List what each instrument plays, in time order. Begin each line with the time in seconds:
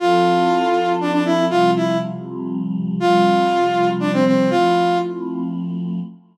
0.00 choir aahs F3 C4 E4 A4, flute F4
1.01 flute D4
1.12 flute D4
1.25 flute E4
1.49 choir aahs C3 F3 G3, flute F4
1.76 flute E4
2.99 choir aahs C3 F3 G3, flute F4
4.00 flute D4
4.13 flute C4
4.26 flute C4
4.50 choir aahs F3 A3 C4 E4, flute F4